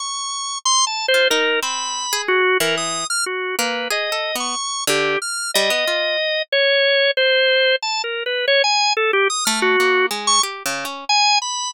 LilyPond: <<
  \new Staff \with { instrumentName = "Drawbar Organ" } { \time 2/4 \tempo 4 = 92 cis'''4 \tuplet 3/2 { c'''8 a''8 c''8 } | ais'8 b''4 fis'8 | ais'16 dis'''8 f'''16 fis'8 b'8 | dis''8. cis'''8. g'8 |
f'''8 dis''4. | cis''4 c''4 | \tuplet 3/2 { a''8 ais'8 b'8 } cis''16 gis''8 a'16 | g'16 dis'''16 f'''16 fis'8. r16 cis'''16 |
r4 gis''8 b''8 | }
  \new Staff \with { instrumentName = "Orchestral Harp" } { \time 2/4 r4. r16 f'16 | dis'8 c'8. gis'8 r16 | e8. r8. ais8 | \tuplet 3/2 { gis'8 a'8 b8 } r8 d8 |
r8 g16 b16 f'8 r8 | r2 | r2 | r8 a8 ais8 gis8 |
\tuplet 3/2 { g'8 cis8 cis'8 } r4 | }
>>